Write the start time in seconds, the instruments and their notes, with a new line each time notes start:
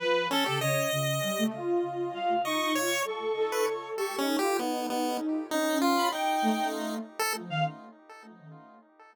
0.00 ocarina F3, clarinet B4
0.31 lead 1 (square) C#4, clarinet A4
0.46 ocarina C#3, lead 1 (square) G4
0.60 ocarina C#3, clarinet C#5, lead 1 (square) D#5
0.92 ocarina C#3
1.23 ocarina G3
1.38 ocarina A3
1.54 ocarina F4
2.14 clarinet F5
2.45 ocarina D#4, lead 1 (square) D#5, clarinet C#6
2.75 ocarina F4, lead 1 (square) C#5
3.05 ocarina A4, clarinet C#6
3.36 ocarina A4
3.52 lead 1 (square) B4
3.67 ocarina A4
3.97 ocarina G4, lead 1 (square) A4, clarinet C#6
4.18 lead 1 (square) C#4, ocarina D#4
4.39 ocarina F4, lead 1 (square) G4
4.59 lead 1 (square) B3, ocarina D#4
4.90 lead 1 (square) B3
5.51 ocarina C#4, lead 1 (square) D#4
5.82 lead 1 (square) F4
5.97 clarinet B5
6.12 lead 1 (square) D#4, clarinet G5
6.42 ocarina A3
7.19 lead 1 (square) A4
7.35 ocarina F3
7.49 ocarina D#3, clarinet F5